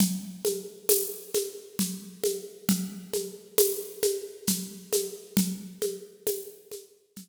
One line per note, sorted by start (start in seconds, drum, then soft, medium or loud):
0.00 low conga loud
0.00 shaker medium
0.45 high conga medium
0.45 shaker medium
0.89 tambourine medium
0.89 high conga medium
0.89 shaker medium
1.34 high conga medium
1.34 shaker medium
1.79 low conga medium
1.79 shaker medium
2.24 high conga medium
2.24 shaker medium
2.69 low conga medium
2.69 shaker medium
3.13 high conga medium
3.13 shaker medium
3.58 tambourine medium
3.58 high conga medium
3.58 shaker medium
4.03 high conga medium
4.03 shaker medium
4.47 low conga medium
4.47 shaker medium
4.93 high conga medium
4.93 shaker medium
5.37 low conga loud
5.37 shaker medium
5.82 high conga medium
5.82 shaker medium
6.27 tambourine medium
6.27 high conga medium
6.27 shaker medium
6.71 high conga medium
6.71 shaker medium
7.16 low conga medium
7.16 shaker medium